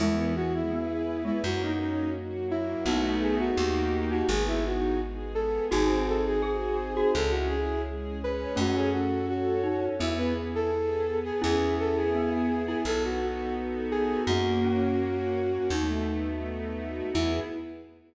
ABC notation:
X:1
M:4/4
L:1/16
Q:1/4=84
K:E
V:1 name="Flute"
E2 F E4 E F D D2 z2 E2 | F2 G F4 F G E F2 z2 A2 | G2 A G4 G A F G2 z2 B2 | F G F2 F4 E B z A4 G |
G2 A G4 G A F F2 z2 G2 | F10 z6 | E4 z12 |]
V:2 name="Glockenspiel"
[E,G,]4 B,3 G, z8 | [B,D]4 =G3 D z8 | [DF]4 G3 F z8 | [A,C]6 D2 B,2 z6 |
[CE]4 B,3 E z8 | ^A,2 C6 D4 z4 | E4 z12 |]
V:3 name="String Ensemble 1"
B,2 E2 G2 B,2 ^A,2 C2 F2 A,2 | [A,B,DF]4 [^A,D=G]4 B,2 D2 ^G2 B,2 | ^B,2 D2 F2 G2 C2 E2 G2 C2 | C2 F2 A2 C2 B,2 E2 G2 B,2 |
B,2 E2 G2 B,2 B,2 D2 F2 A2 | ^A,2 C2 F2 A,2 =A,2 B,2 D2 F2 | [B,EG]4 z12 |]
V:4 name="Electric Bass (finger)" clef=bass
E,,8 F,,8 | B,,,4 D,,4 G,,,8 | G,,,8 C,,8 | F,,8 E,,8 |
E,,8 B,,,8 | F,,8 D,,8 | E,,4 z12 |]
V:5 name="String Ensemble 1"
[B,EG]4 [B,GB]4 [^A,CF]4 [F,A,F]4 | [A,B,DF]4 [^A,D=G]4 [B,D^G]4 [G,B,G]4 | [^B,DFG]4 [B,DG^B]4 [CEG]4 [G,CG]4 | [CFA]4 [CAc]4 [B,EG]4 [B,GB]4 |
[B,EG]8 [B,DFA]8 | [^A,CF]8 [=A,B,DF]8 | [B,EG]4 z12 |]